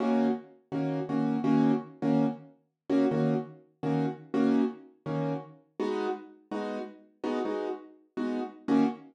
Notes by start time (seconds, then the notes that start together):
0.00 D#3 A#3 C#4 F#4
0.72 D#3 A#3 C#4 F#4
1.09 D#3 A#3 C#4 F#4
1.44 D#3 A#3 C#4 F#4
2.02 D#3 A#3 C#4 F#4
2.90 D#3 A#3 C#4 F#4
3.11 D#3 A#3 C#4 F#4
3.83 D#3 A#3 C#4 F#4
4.34 D#3 A#3 C#4 F#4
5.06 D#3 A#3 C#4 F#4
5.80 G#3 B3 D#4 F#4
6.51 G#3 B3 D#4 F#4
7.24 G#3 B3 D#4 F#4
7.45 G#3 B3 D#4 F#4
8.17 G#3 B3 D#4 F#4
8.68 D#3 A#3 C#4 F#4